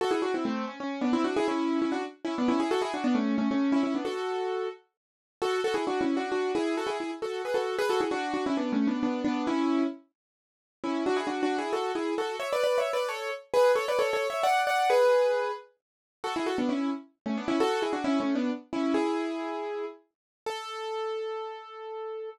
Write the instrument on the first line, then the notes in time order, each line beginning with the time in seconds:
acoustic grand piano
0.01 F#4 A4
0.11 E4 G#4
0.22 D4 F#4
0.34 C4 E4
0.45 A3 C4
0.67 C#4
0.80 C#4
1.01 B3 D4
1.13 C4 E4
1.24 D4 F#4
1.36 E4 G#4
1.48 C#4 E4
1.82 C#4 E4
1.92 D4 F#4
2.25 C#4 E4
2.38 B3 D4
2.48 C#4 E4
2.60 E4 G#4
2.71 F#4 A4
2.82 E4 G#4
2.94 D4 F#4
3.04 B3 D4
3.15 A3 C#4
3.38 A3 C#4
3.51 A3 C#4
3.72 C#4 E4
3.83 C#4 E4
3.95 B3 D4
4.05 F#4 A4
5.42 F#4 A4
5.64 F#4 A4
5.74 E4 G#4
5.87 D4 F#4
6.01 C#4 E4
6.17 D4 F#4
6.32 D4 F#4
6.55 E4 G#4
6.77 F#4 A4
6.87 E4 G#4
7.00 E4 G#4
7.22 F#4 A4
7.45 G#4 B4
7.54 F#4 A4
7.79 G#4 B4
7.89 F#4 A4
8.01 E4 G#4
8.11 D4 F#4
8.34 D4 F#4
8.46 C#4 E4
8.57 B3 D4
8.72 A3 C#4
8.87 B3 D4
9.03 B3 D4
9.25 B3 D4
9.47 C#4 E4
10.84 C#4 E4
11.06 D4 F#4
11.17 E4 G#4
11.27 D4 F#4
11.43 D4 F#4
11.58 E4 G#4
11.73 F#4 A4
11.95 E4 G#4
12.18 F#4 A4
12.40 C#5 E5
12.53 B4 D5
12.64 B4 D5
12.78 C#5 E5
12.93 B4 D5
13.09 A4 C#5
13.54 G#4 B4
13.76 A4 C#5
13.88 B4 D5
13.99 A4 C#5
14.13 A4 C#5
14.30 C#5 E5
14.43 D5 F#5
14.67 D5 F#5
14.90 G#4 B4
16.24 F#4 A4
16.36 E4 G#4
16.46 F#4 A4
16.58 B3 D4
16.69 C#4 E4
17.26 A3 C#4
17.38 B3 D4
17.48 C#4 E4
17.60 F#4 A4
17.82 E4 G#4
17.93 D4 F#4
18.04 C#4 E4
18.20 A3 C#4
18.35 B3 D4
18.73 C#4 E4
18.94 E4 G#4
20.46 A4